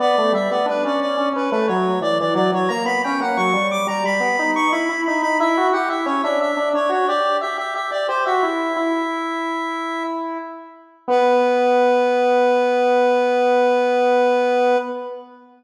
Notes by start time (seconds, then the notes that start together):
0.00 B3 D5
0.18 A3
0.32 G3 E5
0.50 B3 D5
0.66 D4 B4
0.85 C#4 D5
1.01 D5
1.17 C#4
1.33 C#4 B4
1.51 A3 B4
1.68 F#3 C#5
2.01 E3 D5
2.20 E3 D5
2.35 F#3 D5
2.52 F#3 C#5
2.69 A#3 A#5
2.85 B3 B5
3.04 C#4 G5
3.20 A#3 F#5
3.37 F#3 C#6
3.53 G3
3.71 D6
3.87 G3 A#5
4.04 G3 B5
4.20 B3
4.39 D#4
4.56 C#6
4.72 E4 B5
4.89 E4
5.06 D#4 B5
5.22 D#4 B5
5.40 E4 E5
5.57 F#4
5.73 G4 F#5
5.89 E4 E5
6.06 C#4 C#5
6.23 D4 E5
6.41 E5
6.57 D4
6.74 D4 C#5
6.89 F#4 C#5
7.08 G4 D5
7.41 G4 E5
7.58 G4 E5
7.75 G4 E5
7.91 G4 D5
8.08 G4 C5
8.26 F#4 E5
8.43 E4
8.76 E4
11.08 B3 B4